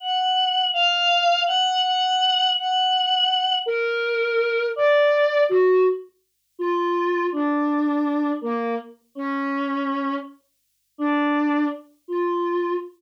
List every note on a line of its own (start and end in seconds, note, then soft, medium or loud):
0.00 0.65 F#5 soft
0.73 1.39 F5 loud
1.46 1.79 F#5 loud
1.83 2.49 F#5 medium
2.56 3.55 F#5 medium
3.66 4.64 A#4 loud
4.76 5.42 D5 medium
5.49 5.82 F#4 loud
6.59 7.24 F4 medium
7.32 8.30 D4 medium
8.41 8.74 A#3 medium
9.15 10.14 C#4 medium
10.98 11.64 D4 medium
12.08 12.73 F4 medium